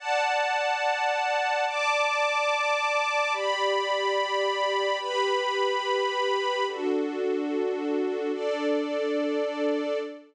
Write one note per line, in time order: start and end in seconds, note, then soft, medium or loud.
0.00 1.65 D5 loud
0.00 1.65 F#5 loud
0.00 1.65 A5 loud
1.67 3.32 D5 loud
1.67 3.32 A5 loud
1.67 3.32 D6 loud
3.33 4.98 G4 loud
3.33 4.98 D5 loud
3.33 4.98 B5 loud
4.99 6.64 G4 loud
4.99 6.64 B4 medium
4.99 6.64 B5 loud
6.66 8.32 D4 medium
6.66 8.32 F#4 loud
6.66 8.32 A4 medium
8.33 9.98 D4 medium
8.33 9.98 A4 loud
8.33 9.98 D5 loud